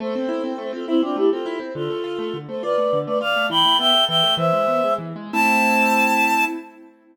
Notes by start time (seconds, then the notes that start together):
0.00 A3 A4 C5
0.15 C4
0.29 E4
0.44 C4
0.58 A3
0.73 C4 F4 A4
0.87 C4 E4
1.02 C4 D4 F4
1.16 A3 E4 G4
1.31 C4 F4 A4
1.46 E4
1.60 C4
1.75 D3 F4 A4
1.90 A3
2.04 F4
2.19 A3
2.34 D3
2.48 A3 A4 C5
2.63 F4 B4 D5
2.78 A3
2.93 D3
3.06 A3 B4 D5
3.21 F4 D5 F5
3.36 A3
3.50 E3 G5 B5
3.65 A3
3.79 B3 E5 G5
3.94 A3
4.09 E3 E5 G5
4.23 A3
4.37 E3 C5 E5
4.53 G#3
4.67 B3
4.84 G#3
4.98 E3
5.16 G#3
5.33 A3 C4 E4 A5